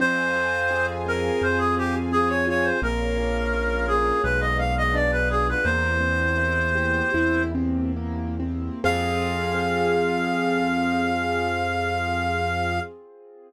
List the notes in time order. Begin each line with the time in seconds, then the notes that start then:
0.00 F2 C4 C5 F5 G#5
0.35 F4
0.71 G#4
1.06 C4 A#4
1.41 F2 F4 C5
1.58 G#4
1.76 G4 G#4
2.12 C4 G#4
2.29 C#5
2.47 F4 C#5
2.64 C5
2.82 A#1 A#3 A#4 C#5 F5
3.18 C#4
3.53 F4
3.87 A#3 G#4
4.24 B1 G#3 G#4 B4 D5 F5
4.40 D#5
4.58 B3 F5
4.78 D#5
4.94 D4 D5
5.12 B4
5.30 F4 G#4
5.49 B4
5.64 E2 A#3 C4 E4 G4 C5
6.01 C4
6.37 E4
6.75 G4
7.14 E2 E4
7.55 C4
7.96 A#3
8.40 C4
8.84 F2 C4 F4 G#4 F5